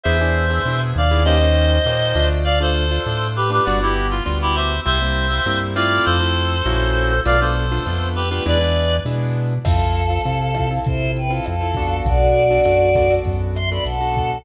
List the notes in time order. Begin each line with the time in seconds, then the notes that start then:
0.04 E2 B3 D4 E4 G#4 C5 E5
0.21 B3 D4 E4 G#4
0.50 B3 D4 E4 G#4
0.65 B2 B3 D4 E4 G#4
0.96 D#2 D5 F5
1.11 B3 D4 E4 G#4
1.25 A#3 C#4 D#4 G4 C5 D#5
1.41 A#3 C#4 D#4 G4
1.85 A#2 A#3 C#4 D#4 G4
2.15 D2 A3 D4 F4
2.44 D5 F5
2.60 A3 D4 F4 A4 C5
2.91 A3 D4 F4
3.06 A2 A3 D4 F4
3.36 G4 B4
3.50 A3 D4 F4 G4 B4
3.65 G1 G3 B3 D4 F#4 D5 F#5
3.80 G3 B3 D4 E4 F#4 G4
4.10 F4
4.24 D2 G3 B3 D4 F4 F#4
4.42 E4 G4
4.55 C5 E5
4.86 C2 G3 A#3 C4 E4 C5 E5
5.02 G3 A#3 C4 E4
5.30 G3 A#3 C4 E4
5.46 G2 G3 A#3 C4 E4
5.75 A3 C4 E4 F4 D5 F5
6.05 F2 A4 C5
6.20 A3 C4 E4 F4
6.66 A#1 A#3 C#4 E4 F#4
7.25 B1 A3 B3 D4 F4 D5 F5
7.41 A3 B3 D4 F4 A4 C5
7.71 A3 B3 D4 F4
7.86 F2 A3 B3 D4 F4
8.15 G4 B4
8.30 A3 B3 D4 F4 G4 B4
8.46 E2 G#3 B3 D4 E4 B4 D5
8.61 G#3 B3 D4 E4
9.05 B2 G#3 B3 D4 E4
9.64 F2 C4 E4 F4 A4 F5, kick, cross-stick, crash
9.96 closed hi-hat
10.10 C4 E4 F4 A4
10.25 C3 C4 E4 F4 A4, closed hi-hat
10.54 C4 E4 F4 A4, kick, cross-stick, closed hi-hat
10.71 C4 E4 F4 A4
10.85 C3 E4 C5, kick, closed hi-hat
11.17 B4 G5, closed hi-hat
11.30 C4 E4 F4 A4 F5
11.45 F2 A4 F5, cross-stick, closed hi-hat
11.61 C4 E4 F4 A4
11.75 B3 D4 F#4 A4, kick, closed hi-hat
12.05 B1 F#4 D5, kick, closed hi-hat
12.35 closed hi-hat
12.50 B3 D4 F#4 A4
12.64 F#2 B3 D4 F#4 A4, cross-stick, closed hi-hat
12.95 B3 D4 F#4 A4, kick, closed hi-hat
13.10 B3 D4 F#4 A4
13.25 F#2, kick, closed hi-hat
13.55 E5 C6, cross-stick, closed hi-hat
13.70 B3 D4 F#4 A4 D5 B5
13.84 B1 A4 F#5, closed hi-hat
14.01 B3 D4 F#4 A4
14.15 kick, closed hi-hat